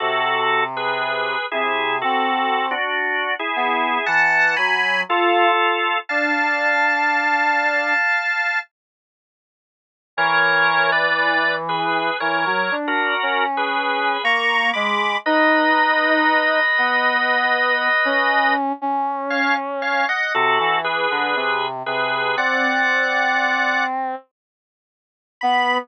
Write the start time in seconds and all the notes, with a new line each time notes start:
0.00 C3 F#4 A4
0.77 G#4 B4
1.51 C3 E4 G#4
2.01 C4 F#4 A4
2.71 D4 F#4
3.39 E4 G#4
3.56 B3
4.06 E3 F#5 A5
4.57 F#3 G#5 B5
5.09 F4 A4
6.09 D4 F5 A5
10.17 E3 A#4 C#5
10.92 B4 D5
11.69 G#4 B4
12.20 E3 A#4 C#5
12.46 F#3
12.71 D4
12.87 F#4 A#4
13.22 C#4
13.57 G#4 B4
14.24 A#3 A#5 C#6
14.73 G#3 B5 D6
15.26 D#4 B4 D#5
16.78 B3
18.05 C#4
18.81 C#4
19.30 C#5 F5
19.82 C#5 F5
20.09 D#5 F#5
20.34 C3 F#4 A4
20.60 E3
20.84 G#4 B4
21.10 D3
21.35 C3
21.86 C3 G#4 B4
22.37 C4 D5 F#5
25.41 B3 B5